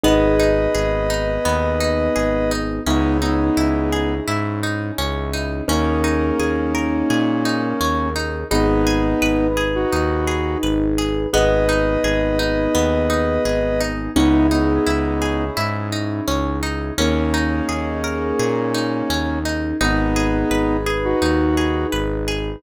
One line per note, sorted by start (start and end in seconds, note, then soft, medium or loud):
0.04 0.68 G#1 medium
0.04 2.80 B3 medium
0.04 0.36 B3 medium
0.04 2.80 D#4 medium
0.04 2.80 G#4 medium
0.04 2.52 B4 medium
0.04 2.52 D#5 medium
0.40 0.71 D#4 medium
0.75 1.39 G#1 medium
0.75 1.06 G#4 medium
1.10 1.42 D#4 medium
1.45 2.09 D#2 medium
1.45 1.77 B3 medium
1.80 2.12 D#4 medium
2.16 2.80 G#1 medium
2.16 2.47 G#4 medium
2.51 2.83 D#4 medium
2.86 3.50 C#2 medium
2.86 3.18 B3 medium
2.86 3.18 C#4 medium
2.86 5.64 C#4 medium
2.86 3.18 D#4 medium
2.86 5.64 D#4 medium
2.86 5.64 E4 medium
2.86 5.64 G#4 medium
3.21 4.15 B3 medium
3.21 4.15 D#4 medium
3.21 3.54 D#4 medium
3.57 4.21 C#2 medium
3.57 3.89 E4 medium
3.92 4.24 G#4 medium
4.27 4.91 G#2 medium
4.27 4.59 E4 medium
4.63 4.95 D#4 medium
4.98 5.62 C#2 medium
4.98 5.30 C#4 medium
5.34 5.65 D#4 medium
5.68 6.32 D#2 medium
5.68 8.10 A#3 medium
5.68 8.45 C#4 medium
5.68 6.01 C#4 medium
5.68 8.10 C#4 medium
5.68 8.45 D#4 medium
5.68 8.45 G#4 medium
5.68 8.45 A#4 medium
6.04 6.36 D#4 medium
6.39 7.03 D#2 medium
6.39 6.71 G#4 medium
6.75 7.06 A#4 medium
7.10 7.74 A#2 medium
7.10 7.42 G#4 medium
7.45 7.77 D#4 medium
7.81 8.44 D#2 medium
7.81 8.12 C#4 medium
8.16 8.47 D#4 medium
8.51 9.15 G#1 loud
8.51 9.47 B3 medium
8.51 11.27 D#4 medium
8.51 8.83 D#4 medium
8.51 9.47 D#4 medium
8.51 11.27 G#4 medium
8.51 11.27 B4 medium
8.87 9.18 G#4 medium
9.22 9.85 G#1 medium
9.22 9.54 B4 medium
9.57 9.89 G#4 medium
9.75 10.58 D#4 medium
9.75 10.58 F#4 medium
9.92 10.56 D#2 medium
9.92 10.24 D#4 medium
10.27 10.59 G#4 medium
10.63 11.26 G#1 medium
10.63 10.95 B4 medium
10.98 11.30 G#4 medium
11.33 11.97 G#1 medium
11.33 14.10 B3 medium
11.33 11.65 B3 medium
11.33 14.10 D#4 medium
11.33 14.10 G#4 medium
11.33 13.82 B4 medium
11.33 13.82 D#5 medium
11.69 12.00 D#4 medium
12.04 12.67 G#1 medium
12.04 12.36 G#4 medium
12.39 12.71 D#4 medium
12.75 13.38 D#2 medium
12.75 13.06 B3 medium
13.10 13.41 D#4 medium
13.45 14.09 G#1 medium
13.45 13.77 G#4 medium
13.81 14.12 D#4 medium
14.16 14.79 C#2 medium
14.16 14.47 B3 medium
14.16 14.48 C#4 medium
14.16 16.93 C#4 medium
14.16 14.47 D#4 medium
14.16 16.93 D#4 medium
14.16 16.93 E4 medium
14.16 16.93 G#4 medium
14.51 15.45 B3 medium
14.51 14.83 D#4 medium
14.51 15.45 D#4 medium
14.86 15.50 C#2 medium
14.86 15.18 E4 medium
15.22 15.53 G#4 medium
15.57 16.21 G#2 medium
15.57 15.89 E4 medium
15.92 16.24 D#4 medium
16.28 16.91 C#2 medium
16.28 16.59 C#4 medium
16.63 16.94 D#4 medium
16.98 17.61 D#2 medium
16.98 19.39 A#3 medium
16.98 17.30 C#4 medium
16.98 19.39 C#4 medium
16.98 19.76 C#4 medium
16.98 19.76 D#4 medium
16.98 19.76 G#4 medium
16.98 19.76 A#4 medium
17.34 17.66 D#4 medium
17.69 18.32 D#2 medium
17.69 18.00 G#4 medium
18.04 18.36 A#4 medium
18.39 19.03 A#2 medium
18.39 18.71 G#4 medium
18.74 19.06 D#4 medium
19.10 19.73 D#2 medium
19.10 19.42 C#4 medium
19.45 19.77 D#4 medium
19.81 20.44 G#1 loud
19.81 20.77 B3 medium
19.81 20.12 D#4 medium
19.81 20.77 D#4 medium
19.81 22.58 D#4 medium
19.81 22.58 G#4 medium
19.81 22.58 B4 medium
20.16 20.48 G#4 medium
20.51 21.14 G#1 medium
20.51 20.83 B4 medium
20.86 21.18 G#4 medium
21.04 21.87 D#4 medium
21.04 21.87 F#4 medium
21.22 21.85 D#2 medium
21.22 21.54 D#4 medium
21.57 21.89 G#4 medium
21.92 22.56 G#1 medium
21.92 22.24 B4 medium
22.28 22.60 G#4 medium